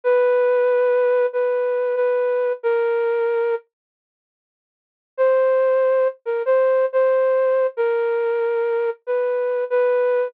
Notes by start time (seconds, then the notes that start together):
0.04 B4
1.33 B4
1.96 B4
2.63 A#4
5.17 C5
6.26 A#4
6.46 C5
6.93 C5
7.77 A#4
9.07 B4
9.70 B4